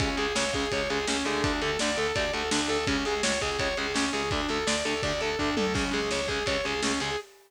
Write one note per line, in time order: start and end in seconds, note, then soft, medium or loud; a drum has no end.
0.00 0.15 C#2 loud
0.00 0.07 C#3 loud
0.00 0.07 G#3 loud
0.00 0.16 C#4 medium
0.00 kick loud
0.00 ride loud
0.17 0.32 C#2 medium
0.17 0.24 C#3 medium
0.17 0.24 G#3 loud
0.17 0.35 G#4 medium
0.17 ride medium
0.35 0.51 C#2 medium
0.35 0.43 C#3 medium
0.35 0.43 G#3 medium
0.35 0.52 C#5 medium
0.35 snare loud
0.53 0.68 C#2 medium
0.53 0.63 C#3 medium
0.53 0.63 G#3 medium
0.53 0.71 G#4 medium
0.53 kick medium
0.53 ride medium
0.71 0.88 C#2 medium
0.71 0.80 C#3 medium
0.71 0.80 G#3 medium
0.71 0.89 C#5 medium
0.71 kick medium
0.71 ride loud
0.90 1.05 C#2 medium
0.90 0.97 C#3 medium
0.90 0.97 G#3 medium
0.90 1.06 G#4 medium
0.90 ride medium
1.07 1.23 C#2 medium
1.07 1.15 C#3 medium
1.07 1.15 G#3 medium
1.07 1.25 C#4 medium
1.07 snare loud
1.25 1.41 C#2 medium
1.25 1.50 D3 loud
1.25 1.50 A3 loud
1.25 1.43 G#4 medium
1.25 ride medium
1.43 1.60 D2 loud
1.43 1.60 D4 medium
1.43 kick loud
1.43 ride loud
1.61 1.77 D2 medium
1.61 1.69 D3 medium
1.61 1.69 A3 medium
1.61 1.78 A4 medium
1.61 ride medium
1.79 1.96 D2 loud
1.79 1.89 D3 medium
1.79 1.89 A3 medium
1.79 1.96 D5 medium
1.79 snare loud
1.96 2.12 D2 medium
1.96 2.04 D3 medium
1.96 2.04 A3 medium
1.96 2.15 A4 medium
1.96 ride medium
2.15 2.31 D2 medium
2.15 2.24 D3 medium
2.15 2.24 A3 medium
2.15 2.32 D5 medium
2.15 kick medium
2.15 ride loud
2.33 2.49 D2 medium
2.33 2.41 D3 medium
2.33 2.41 A3 medium
2.33 2.49 A4 medium
2.33 ride medium
2.51 2.67 D2 loud
2.51 2.59 D3 medium
2.51 2.59 A3 medium
2.51 2.68 D4 medium
2.51 snare loud
2.68 2.84 D2 medium
2.68 2.75 D3 medium
2.68 2.75 A3 medium
2.68 2.86 A4 medium
2.68 ride medium
2.87 3.03 C#2 loud
2.87 2.94 C#3 loud
2.87 2.94 G#3 medium
2.87 3.04 C#4 medium
2.87 kick loud
2.87 ride loud
3.05 3.21 C#2 medium
3.05 3.13 C#3 medium
3.05 3.13 G#3 medium
3.05 3.22 G#4 medium
3.05 ride medium
3.23 3.38 C#2 medium
3.23 3.31 C#3 medium
3.23 3.31 G#3 medium
3.23 3.39 C#5 medium
3.23 snare loud
3.41 3.57 C#2 loud
3.41 3.48 C#3 medium
3.41 3.48 G#3 medium
3.41 3.58 G#4 medium
3.41 kick medium
3.41 ride medium
3.59 3.74 C#2 medium
3.59 3.67 C#3 medium
3.59 3.67 G#3 medium
3.59 3.76 C#5 medium
3.59 kick medium
3.59 ride loud
3.77 3.93 C#2 medium
3.77 3.85 C#3 medium
3.77 3.85 G#3 medium
3.77 3.94 G#4 medium
3.77 ride medium
3.94 4.09 C#2 medium
3.94 4.03 C#3 medium
3.94 4.03 G#3 medium
3.94 4.11 C#4 medium
3.94 snare loud
4.13 4.29 C#2 medium
4.13 4.20 C#3 medium
4.13 4.20 G#3 medium
4.13 4.29 G#4 medium
4.13 ride medium
4.31 4.46 D2 loud
4.31 4.39 D3 medium
4.31 4.39 A3 loud
4.31 4.48 D4 medium
4.31 kick loud
4.31 ride medium
4.49 4.64 D2 medium
4.49 4.57 D3 medium
4.49 4.57 A3 medium
4.49 4.66 A4 medium
4.49 ride medium
4.67 4.82 D2 medium
4.67 4.74 D3 medium
4.67 4.74 A3 medium
4.67 4.83 D5 medium
4.67 snare loud
4.85 5.01 D2 medium
4.85 4.93 D3 medium
4.85 4.93 A3 medium
4.85 5.01 A4 medium
4.85 ride medium
5.03 5.19 D2 loud
5.03 5.11 D3 medium
5.03 5.11 A3 medium
5.03 5.20 D5 medium
5.03 kick medium
5.03 ride loud
5.20 5.35 D2 medium
5.20 5.29 D3 medium
5.20 5.29 A3 medium
5.20 5.38 A4 medium
5.20 ride medium
5.38 5.55 D2 loud
5.38 5.48 D3 medium
5.38 5.48 A3 medium
5.38 5.55 D4 medium
5.38 kick medium
5.38 floor tom medium
5.56 5.72 D2 loud
5.56 5.64 D3 medium
5.56 5.64 A3 medium
5.56 5.73 A4 medium
5.56 high tom loud
5.74 5.89 C#2 loud
5.74 5.82 C#3 loud
5.74 5.82 G#3 medium
5.74 5.91 C#4 medium
5.74 kick loud
5.74 crash loud
5.91 6.09 C#2 medium
5.91 5.98 C#3 medium
5.91 5.98 G#3 medium
5.91 6.10 G#4 medium
5.91 ride medium
6.11 6.26 C#2 medium
6.11 6.18 C#3 medium
6.11 6.18 G#3 medium
6.11 6.27 C#5 medium
6.11 snare medium
6.28 6.43 C#2 medium
6.28 6.38 C#3 medium
6.28 6.38 G#3 medium
6.28 6.45 G#4 medium
6.28 kick medium
6.28 ride medium
6.46 6.61 C#2 medium
6.46 6.55 C#3 medium
6.46 6.55 G#3 medium
6.46 6.63 C#5 medium
6.46 kick medium
6.46 ride loud
6.64 6.80 C#2 loud
6.64 6.72 C#3 medium
6.64 6.72 G#3 medium
6.64 6.82 G#4 medium
6.64 ride medium
6.82 6.98 C#2 loud
6.82 6.90 C#3 medium
6.82 6.90 G#3 medium
6.82 6.99 C#4 medium
6.82 snare loud
7.00 7.15 C#2 medium
7.00 7.08 C#3 medium
7.00 7.08 G#3 medium
7.00 7.17 G#4 medium
7.00 ride medium